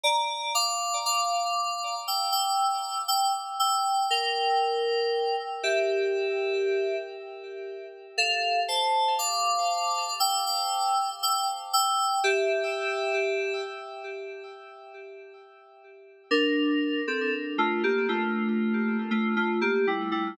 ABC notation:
X:1
M:4/4
L:1/16
Q:1/4=59
K:Dm
V:1 name="Electric Piano 2"
[db]2 [fd']2 [fd']4 [ge'] [ge']3 [ge'] z [ge']2 | [Bg]6 [Ge]6 z4 | [Af]2 [ca]2 [fd']4 [ge'] [ge']3 [ge'] z [ge']2 | [Ge]6 z10 |
[DB]3 [CA] z [A,F] [B,G] [A,F]4 [A,F] [A,F] [B,G] [G,E] [G,E] |]